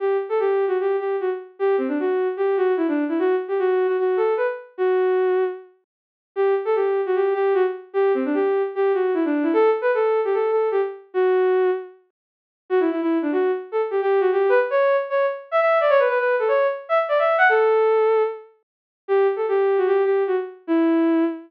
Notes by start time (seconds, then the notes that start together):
0.00 G4
0.29 A4
0.40 G4
0.68 F#4
0.80 G4
0.99 G4
1.21 F#4
1.59 G4
1.78 C4
1.88 D4
2.00 F#4
2.37 G4
2.57 F#4
2.77 E4
2.88 D4
3.09 E4
3.19 F#4
3.48 G4
3.59 F#4
3.87 F#4
3.99 F#4
4.17 A4
4.37 B4
4.78 F#4
6.36 G4
6.65 A4
6.75 G4
7.06 F#4
7.16 G4
7.34 G4
7.54 F#4
7.93 G4
8.14 C4
8.25 D4
8.34 G4
8.75 G4
8.94 F#4
9.14 E4
9.25 D4
9.43 E4
9.53 A4
9.81 B4
9.94 A4
10.25 G4
10.34 A4
10.51 A4
10.71 G4
11.14 F#4
12.70 F#4
12.80 E4
12.91 E4
13.02 E4
13.22 D4
13.32 F#4
13.72 A4
13.91 G4
14.02 G4
14.20 F#4
14.32 G4
14.49 B4
14.70 C#5
15.10 C#5
15.51 E5
15.60 E5
15.81 D5
15.90 C#5
15.99 B4
16.09 B4
16.19 B4
16.39 A4
16.48 C#5
16.89 E5
17.09 D5
17.19 E5
17.38 F#5
17.49 A4
19.08 G4
19.36 A4
19.48 G4
19.78 F#4
19.87 G4
20.05 G4
20.27 F#4
20.67 E4